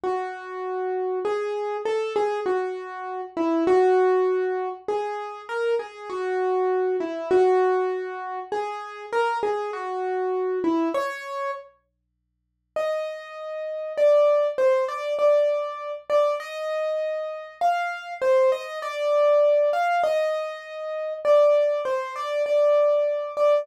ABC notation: X:1
M:6/8
L:1/8
Q:3/8=66
K:E
V:1 name="Acoustic Grand Piano"
F4 G2 | A G F3 E | F4 G2 | ^A G F3 E |
F4 G2 | ^A G F3 E | c2 z4 | [K:Eb] e4 d2 |
c d d3 d | e4 f2 | c e d3 f | e4 d2 |
c d d3 d |]